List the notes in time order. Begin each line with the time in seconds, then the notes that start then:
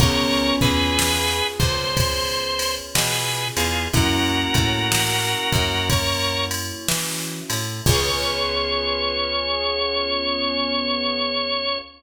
0.00 C#2 B3 C#4 F4 G#4 A#4 C#5, kick, ride
0.61 E2 G#4 B4, kick, ride
0.99 snare
1.59 C#2 C5, kick, ride
1.97 kick, ride
2.59 ride
2.95 B2 G#4 B4, snare
3.57 E2 F4 G#4, ride
3.93 F#2 A#3 C#4 E4 F#4 A#4, kick, ride
4.54 A2, kick, ride
4.92 snare
5.52 F#2, kick, ride
5.90 A#4 C#5, kick, ride
6.51 ride
6.89 E3, snare
7.50 A2, ride
7.86 C#2 B3 C#4 F4 G#4 C#5, kick, crash